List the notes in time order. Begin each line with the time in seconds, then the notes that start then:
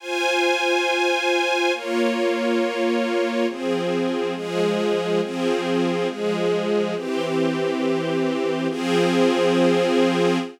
0.00 F4 C5 G#5
1.74 A#3 F4 C#5
3.48 F3 C4 G#4
4.35 F3 G#3 G#4
5.21 F3 C4 G#4
6.08 F3 G#3 G#4
6.95 E3 C4 G4
8.69 F3 C4 G#4